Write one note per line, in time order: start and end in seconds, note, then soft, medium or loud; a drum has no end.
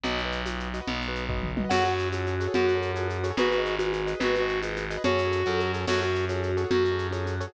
0.04 0.80 B1 medium
0.04 0.21 F#4 medium
0.04 0.21 B4 medium
0.04 0.21 D#5 loud
0.04 low conga medium
0.04 shaker medium
0.18 shaker medium
0.25 0.42 F#4 medium
0.25 0.42 B4 medium
0.25 0.42 D#5 medium
0.32 shaker medium
0.46 0.68 F#4 medium
0.46 0.68 B4 medium
0.46 0.68 D#5 medium
0.46 high conga medium
0.46 shaker medium
0.60 shaker medium
0.74 0.79 F#4 medium
0.74 0.79 B4 medium
0.74 0.79 D#5 medium
0.74 shaker medium
0.81 1.03 F#4 medium
0.81 1.03 B4 medium
0.81 1.03 D#5 medium
0.87 1.64 B1 medium
0.87 low conga loud
0.87 shaker medium
1.01 shaker medium
1.08 1.25 F#4 medium
1.08 1.25 B4 medium
1.08 1.25 D#5 medium
1.15 shaker medium
1.29 1.51 F#4 medium
1.29 1.51 B4 medium
1.29 1.51 D#5 medium
1.29 kick medium
1.29 floor tom medium
1.43 mid tom medium
1.57 1.62 F#4 medium
1.57 1.62 B4 medium
1.57 1.62 D#5 medium
1.57 high tom loud
1.64 1.69 F#4 medium
1.64 1.69 B4 medium
1.64 1.69 D#5 medium
1.69 2.47 F#2 medium
1.69 1.84 F#4 loud
1.69 1.87 F#4 loud
1.69 1.87 G#4 loud
1.69 1.87 A4 loud
1.69 1.87 C#5 loud
1.69 1.93 F#5 loud
1.69 crash loud
1.69 low conga medium
1.69 shaker medium
1.85 2.08 F#4 medium
1.85 shaker medium
1.92 2.08 F#4 loud
1.92 2.08 G#4 medium
1.92 2.08 A4 medium
1.92 2.08 C#5 medium
1.99 shaker medium
2.13 2.35 F#4 medium
2.13 2.27 F#4 medium
2.13 2.35 G#4 loud
2.13 2.35 A4 medium
2.13 2.35 C#5 medium
2.13 high conga medium
2.13 shaker medium
2.26 2.52 F#4 medium
2.26 shaker medium
2.40 2.46 F#4 medium
2.40 2.46 G#4 loud
2.40 2.46 A4 loud
2.40 2.46 C#5 loud
2.40 shaker medium
2.47 2.70 F#4 loud
2.47 2.70 G#4 medium
2.47 2.70 A4 medium
2.47 2.70 C#5 medium
2.54 3.32 F#2 medium
2.54 2.66 F#4 loud
2.54 2.80 F#4 loud
2.54 low conga loud
2.54 shaker medium
2.68 2.91 F#4 medium
2.68 shaker medium
2.75 2.92 F#4 loud
2.75 2.92 G#4 medium
2.75 2.92 A4 medium
2.75 2.92 C#5 medium
2.82 shaker medium
2.94 3.07 F#4 medium
2.94 3.18 F#4 medium
2.94 3.18 G#4 loud
2.94 3.18 A4 medium
2.94 3.18 C#5 medium
2.94 high conga medium
2.94 shaker medium
3.09 3.34 F#4 medium
3.09 shaker medium
3.24 3.29 F#4 medium
3.24 3.29 G#4 loud
3.24 3.29 A4 loud
3.24 3.29 C#5 loud
3.24 shaker medium
3.31 3.36 F#4 loud
3.31 3.36 G#4 medium
3.31 3.36 A4 medium
3.31 3.36 C#5 medium
3.37 4.14 G#1 medium
3.37 3.49 F#4 loud
3.37 3.54 G#4 loud
3.37 3.54 B4 loud
3.37 3.62 B4 medium
3.37 3.54 D#5 loud
3.37 low conga loud
3.37 shaker medium
3.50 3.75 F#4 medium
3.50 shaker medium
3.58 3.75 G#4 medium
3.58 3.75 B4 loud
3.58 3.75 D#5 loud
3.65 shaker medium
3.79 3.91 F#4 medium
3.79 4.01 G#4 loud
3.79 4.01 B4 medium
3.79 4.01 D#5 medium
3.79 high conga medium
3.79 shaker medium
3.93 4.18 F#4 medium
3.93 shaker medium
4.07 4.12 G#4 medium
4.07 4.12 B4 loud
4.07 4.12 D#5 medium
4.07 shaker medium
4.14 4.36 G#4 medium
4.14 4.36 B4 medium
4.14 4.36 D#5 medium
4.20 4.97 G#1 medium
4.20 4.35 F#4 loud
4.20 4.45 B4 loud
4.20 low conga medium
4.20 shaker medium
4.35 4.60 F#4 loud
4.35 shaker medium
4.42 4.58 G#4 medium
4.42 4.58 B4 loud
4.42 4.58 D#5 loud
4.49 shaker medium
4.63 4.75 F#4 medium
4.63 4.85 G#4 medium
4.63 4.85 B4 medium
4.63 4.85 D#5 loud
4.63 high conga medium
4.63 shaker medium
4.76 5.02 F#4 medium
4.76 shaker medium
4.90 4.96 G#4 loud
4.90 4.96 B4 medium
4.90 4.96 D#5 loud
4.90 shaker medium
4.97 5.03 G#4 loud
4.97 5.03 B4 medium
4.97 5.03 D#5 loud
5.04 5.43 F#2 medium
5.04 5.21 F#4 loud
5.04 5.72 F#4 loud
5.04 5.21 G#4 loud
5.04 5.21 A4 loud
5.04 5.21 C#5 loud
5.04 5.44 C#5 medium
5.04 low conga loud
5.04 shaker medium
5.18 shaker medium
5.25 5.42 F#4 loud
5.25 5.42 G#4 loud
5.25 5.42 A4 loud
5.25 5.42 C#5 medium
5.32 shaker medium
5.46 5.85 F#2 medium
5.46 5.68 F#4 medium
5.46 5.68 G#4 loud
5.46 5.68 A4 medium
5.46 5.60 A4 medium
5.46 5.68 C#5 medium
5.46 high conga medium
5.46 shaker medium
5.60 shaker medium
5.74 5.79 F#4 medium
5.74 5.79 G#4 medium
5.74 5.79 A4 loud
5.74 5.79 C#5 medium
5.74 shaker medium
5.80 5.86 F#4 medium
5.80 5.86 G#4 loud
5.80 5.86 A4 loud
5.80 5.86 C#5 loud
5.87 6.65 F#2 medium
5.87 6.04 F#4 loud
5.87 6.01 F#4 loud
5.87 6.04 G#4 loud
5.87 6.04 A4 loud
5.87 6.04 C#5 loud
5.87 6.12 F#5 loud
5.87 crash loud
5.87 low conga medium
5.87 shaker medium
6.01 6.25 F#4 medium
6.01 shaker medium
6.08 6.25 F#4 loud
6.08 6.25 G#4 medium
6.08 6.25 A4 medium
6.08 6.25 C#5 medium
6.15 shaker medium
6.29 6.51 F#4 medium
6.29 6.42 F#4 medium
6.29 6.51 G#4 loud
6.29 6.51 A4 medium
6.29 6.51 C#5 medium
6.29 high conga medium
6.29 shaker medium
6.42 6.67 F#4 medium
6.42 shaker medium
6.57 6.63 F#4 medium
6.57 6.63 G#4 loud
6.57 6.63 A4 loud
6.57 6.63 C#5 loud
6.57 shaker medium
6.64 6.86 F#4 loud
6.64 6.86 G#4 medium
6.64 6.86 A4 medium
6.64 6.86 C#5 medium
6.70 7.47 F#2 medium
6.70 6.96 F#4 loud
6.70 6.83 F#4 loud
6.70 low conga loud
6.70 shaker medium
6.84 7.07 F#4 medium
6.84 shaker medium
6.92 7.08 F#4 loud
6.92 7.08 G#4 medium
6.92 7.08 A4 medium
6.92 7.08 C#5 medium
6.99 shaker medium
7.11 7.23 F#4 medium
7.11 7.35 F#4 medium
7.11 7.35 G#4 loud
7.11 7.35 A4 medium
7.11 7.35 C#5 medium
7.11 high conga medium
7.11 shaker medium
7.26 7.51 F#4 medium
7.26 shaker medium
7.40 7.46 F#4 medium
7.40 7.46 G#4 loud
7.40 7.46 A4 loud
7.40 7.46 C#5 loud
7.40 shaker medium
7.47 7.53 F#4 loud
7.47 7.53 G#4 medium
7.47 7.53 A4 medium
7.47 7.53 C#5 medium